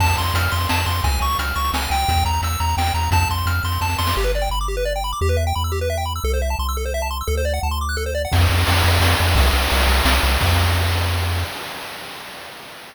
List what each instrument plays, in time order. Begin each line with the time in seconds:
0.00 synth bass 1 F2, lead 1 (square) A5, kick, crash
0.09 closed hi-hat
0.17 synth bass 1 F2, lead 1 (square) C6, closed hi-hat
0.26 closed hi-hat
0.34 synth bass 1 F2, lead 1 (square) F6, closed hi-hat
0.43 closed hi-hat
0.52 synth bass 1 F2, lead 1 (square) C6, closed hi-hat
0.61 closed hi-hat
0.69 synth bass 1 F2, lead 1 (square) A5, snare
0.78 closed hi-hat
0.86 synth bass 1 F2, lead 1 (square) C6, closed hi-hat
0.95 closed hi-hat
1.04 synth bass 1 C#2, lead 1 (square) G#5, kick, closed hi-hat
1.13 closed hi-hat
1.21 synth bass 1 C#2, lead 1 (square) C#6, closed hi-hat
1.31 closed hi-hat
1.39 synth bass 1 C#2, lead 1 (square) F6, closed hi-hat
1.48 closed hi-hat
1.56 synth bass 1 C#2, lead 1 (square) C#6, closed hi-hat
1.64 closed hi-hat
1.73 synth bass 1 C#2, lead 1 (square) G#5, snare
1.82 closed hi-hat
1.90 synth bass 1 C#2, lead 1 (square) G5, closed hi-hat
1.99 closed hi-hat
2.08 synth bass 1 E2, kick, closed hi-hat
2.17 closed hi-hat
2.25 synth bass 1 E2, lead 1 (square) A#5, closed hi-hat
2.33 closed hi-hat
2.42 synth bass 1 E2, lead 1 (square) E6, closed hi-hat
2.52 closed hi-hat
2.60 synth bass 1 E2, lead 1 (square) A#5, closed hi-hat
2.69 closed hi-hat
2.77 synth bass 1 E2, lead 1 (square) G5, snare
2.86 closed hi-hat
2.94 synth bass 1 E2, lead 1 (square) A#5, closed hi-hat
3.03 closed hi-hat
3.11 synth bass 1 F2, lead 1 (square) A5, kick, closed hi-hat
3.22 closed hi-hat
3.30 synth bass 1 F2, lead 1 (square) C6, closed hi-hat
3.38 closed hi-hat
3.46 synth bass 1 F2, lead 1 (square) F6, closed hi-hat
3.55 closed hi-hat
3.64 synth bass 1 F2, lead 1 (square) C6, closed hi-hat
3.72 closed hi-hat
3.81 synth bass 1 F2, lead 1 (square) A5, kick, snare
3.89 snare
3.98 synth bass 1 F2, lead 1 (square) C6, snare
4.07 snare
4.17 synth bass 1 G1, lead 1 (square) G4
4.24 lead 1 (square) B4
4.35 lead 1 (square) D5
4.42 lead 1 (square) G5
4.50 synth bass 1 G1, lead 1 (square) B5
4.61 lead 1 (square) D6
4.68 lead 1 (square) G4
4.77 lead 1 (square) B4
4.85 lead 1 (square) D5
4.96 lead 1 (square) G5
5.04 lead 1 (square) B5
5.13 lead 1 (square) D6
5.21 synth bass 1 E2, lead 1 (square) G4
5.29 lead 1 (square) B4
5.37 lead 1 (square) E5
5.47 lead 1 (square) G5
5.55 synth bass 1 E2, lead 1 (square) B5
5.64 lead 1 (square) E6
5.72 lead 1 (square) G4
5.81 lead 1 (square) B4
5.90 lead 1 (square) E5
5.98 lead 1 (square) G5
6.06 lead 1 (square) B5
6.16 lead 1 (square) E6
6.24 synth bass 1 C2, lead 1 (square) A4
6.34 lead 1 (square) C5
6.42 lead 1 (square) E5
6.50 lead 1 (square) A5
6.59 synth bass 1 C2, lead 1 (square) C6
6.69 lead 1 (square) E6
6.77 lead 1 (square) A4
6.85 lead 1 (square) C5
6.94 lead 1 (square) E5
7.02 lead 1 (square) A5
7.11 lead 1 (square) C6
7.21 lead 1 (square) E6
7.27 synth bass 1 D2, lead 1 (square) A4
7.37 lead 1 (square) C5
7.45 lead 1 (square) D5
7.54 lead 1 (square) F#5
7.63 synth bass 1 D2, lead 1 (square) A5
7.71 lead 1 (square) C6
7.81 lead 1 (square) D6
7.89 lead 1 (square) F#6
7.97 lead 1 (square) A4
8.06 lead 1 (square) C5
8.15 lead 1 (square) D5
8.25 lead 1 (square) F#5
8.32 synth bass 1 F2, kick, crash
8.41 ride
8.50 synth bass 1 F2, ride
8.58 ride
8.67 synth bass 1 F2, ride
8.75 ride
8.84 synth bass 1 F2, ride
8.93 ride
9.00 synth bass 1 F2, snare
9.11 ride
9.20 synth bass 1 F2, ride
9.28 ride
9.35 synth bass 1 C2, kick, ride
9.46 ride
9.53 synth bass 1 C2, ride
9.62 ride
9.70 synth bass 1 C2, ride
9.81 ride
9.87 synth bass 1 C2, ride
9.97 ride
10.05 synth bass 1 C2, snare
10.15 ride
10.22 synth bass 1 C2, ride
10.32 ride
10.41 synth bass 1 F2, kick, crash